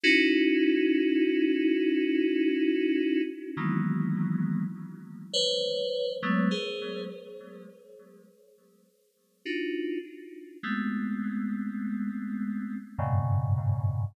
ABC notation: X:1
M:6/8
L:1/16
Q:3/8=34
K:none
V:1 name="Electric Piano 2"
[_D_E=E_G]12 | [_E,=E,_G,_A,_B,=B,]4 z2 [Bc_d]3 [G,A,=A,B,] [_A_Bc]2 | z8 [D_EF_G]2 z2 | [_A,=A,B,C]8 [_G,,=G,,_A,,_B,,=B,,_D,]4 |]